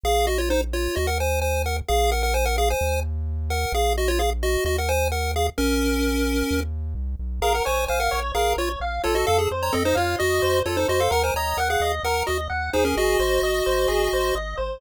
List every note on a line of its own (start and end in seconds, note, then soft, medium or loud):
0.03 0.88 A#1 loud
0.03 0.26 G#4 medium
0.03 0.26 F5 medium
0.27 0.38 F#4 medium
0.27 0.38 D#5 medium
0.38 0.49 F4 medium
0.38 0.49 C#5 medium
0.50 0.61 D#4 medium
0.50 0.61 C5 medium
0.73 0.95 F4 medium
0.73 0.95 C#5 medium
0.96 1.82 D#2 loud
0.96 1.07 F#4 medium
0.96 1.07 D#5 medium
1.07 1.18 A#4 medium
1.07 1.18 F#5 medium
1.20 1.40 C5 medium
1.20 1.40 G#5 medium
1.42 1.62 C5 medium
1.42 1.62 G#5 medium
1.66 1.77 A#4 medium
1.66 1.77 F#5 medium
1.88 2.74 A#1 loud
1.88 2.11 G#4 medium
1.88 2.11 F5 medium
2.12 2.22 A#4 medium
2.12 2.22 F#5 medium
2.23 2.34 A#4 medium
2.23 2.34 F#5 medium
2.34 2.45 C5 medium
2.34 2.45 G#5 medium
2.45 2.56 A#4 medium
2.45 2.56 F#5 medium
2.58 2.69 G#4 medium
2.58 2.69 F5 medium
2.70 3.00 C5 medium
2.70 3.00 G#5 medium
2.81 3.66 D#2 loud
3.50 3.73 A#4 medium
3.50 3.73 F#5 medium
3.72 4.57 A#1 loud
3.72 3.93 G#4 medium
3.72 3.93 F5 medium
3.97 4.08 F#4 medium
3.97 4.08 D#5 medium
4.08 4.19 F4 medium
4.08 4.19 C#5 medium
4.19 4.30 G#4 medium
4.19 4.30 F5 medium
4.43 4.64 F#4 medium
4.43 4.64 D#5 medium
4.65 5.50 D#2 loud
4.65 4.77 F#4 medium
4.65 4.77 D#5 medium
4.78 4.89 A#4 medium
4.78 4.89 F#5 medium
4.89 5.08 C5 medium
4.89 5.08 G#5 medium
5.12 5.32 A#4 medium
5.12 5.32 F#5 medium
5.36 5.47 G#4 medium
5.36 5.47 F5 medium
5.58 6.43 A#1 loud
5.58 6.60 C#4 medium
5.58 6.60 A#4 medium
6.51 6.95 D#2 loud
6.95 7.16 C2 loud
7.19 7.40 B1 medium
7.41 7.61 A#1 medium
7.41 7.53 G#4 medium
7.41 7.62 A#4 medium
7.41 7.53 F5 medium
7.54 7.65 A#4 medium
7.54 7.65 F#5 medium
7.65 7.87 A#1 medium
7.65 7.85 C5 medium
7.65 7.86 C#5 medium
7.65 7.85 G#5 medium
7.88 8.09 A#1 medium
7.88 7.99 C5 medium
7.88 8.10 F5 medium
7.88 7.99 G#5 medium
8.00 8.20 A#4 medium
8.00 8.20 F#5 medium
8.11 8.32 A#1 medium
8.11 8.32 C#5 medium
8.35 8.54 A#1 medium
8.35 8.53 G#4 medium
8.35 8.55 A#4 medium
8.35 8.53 F5 medium
8.57 8.76 A#1 medium
8.57 8.69 F4 medium
8.57 8.69 C#5 medium
8.57 8.79 C#5 medium
8.80 9.00 A#1 medium
8.80 9.02 F5 medium
9.04 9.25 A#1 medium
9.04 9.15 F4 medium
9.04 9.48 A4 medium
9.04 9.15 C#5 medium
9.15 9.26 F#4 medium
9.15 9.26 D#5 medium
9.27 9.48 F2 loud
9.27 9.38 A4 medium
9.27 9.38 F5 medium
9.38 9.49 G#4 medium
9.51 9.71 F2 medium
9.51 9.72 C5 medium
9.62 9.73 C#5 medium
9.62 9.73 A#5 medium
9.72 9.94 F2 medium
9.72 9.83 C4 medium
9.72 9.83 A4 medium
9.72 9.94 D#5 medium
9.85 9.96 D#4 medium
9.85 9.96 C5 medium
9.95 10.16 F2 medium
9.95 10.16 F4 medium
9.95 10.16 C#5 medium
9.95 10.15 F5 medium
10.19 10.40 F2 medium
10.19 10.60 F#4 medium
10.19 10.39 D#5 medium
10.19 10.60 D#5 medium
10.42 10.62 F2 medium
10.42 10.63 C5 medium
10.65 10.85 F2 medium
10.65 10.76 F4 medium
10.65 10.87 A4 medium
10.65 10.76 C#5 medium
10.77 10.88 D#4 medium
10.77 10.88 C5 medium
10.88 11.08 F2 medium
10.88 11.00 F#4 medium
10.88 11.09 C5 medium
10.88 11.00 D#5 medium
11.00 11.11 A4 medium
11.00 11.11 F5 medium
11.10 11.31 D#2 medium
11.10 11.31 A#4 medium
11.10 11.23 A#4 medium
11.10 11.23 F#5 medium
11.23 11.34 C5 medium
11.23 11.34 G#5 medium
11.34 11.54 D#2 medium
11.34 11.57 C#5 medium
11.34 11.57 D#5 medium
11.34 11.57 A#5 medium
11.57 11.77 D#2 medium
11.57 11.68 A#4 medium
11.57 11.68 F#5 medium
11.57 11.80 F#5 medium
11.70 11.92 G#4 medium
11.70 11.92 F5 medium
11.80 12.00 D#2 medium
11.80 12.02 D#5 medium
12.03 12.23 D#2 medium
12.03 12.23 A#4 medium
12.03 12.26 A#4 medium
12.03 12.23 F#5 medium
12.27 12.48 D#2 medium
12.27 12.38 F#4 medium
12.27 12.38 D#5 medium
12.27 12.47 D#5 medium
12.49 12.70 D#2 medium
12.49 12.70 F#5 medium
12.73 12.94 D#2 medium
12.73 12.84 D#4 medium
12.73 13.17 G#4 medium
12.73 12.84 C5 medium
12.85 12.96 C#4 medium
12.85 12.96 A#4 medium
12.97 13.16 G#1 medium
12.97 14.35 F#4 medium
12.97 14.35 D#5 medium
13.19 13.39 G#1 medium
13.19 13.40 C5 medium
13.42 13.62 G#1 medium
13.42 13.64 D#5 medium
13.66 13.87 G#1 medium
13.66 13.87 C5 medium
13.88 14.09 G#1 medium
13.88 14.09 G#4 medium
14.13 14.32 G#1 medium
14.13 14.34 C5 medium
14.35 14.55 G#1 medium
14.35 14.56 D#5 medium
14.57 14.78 G#1 medium
14.57 14.78 C5 medium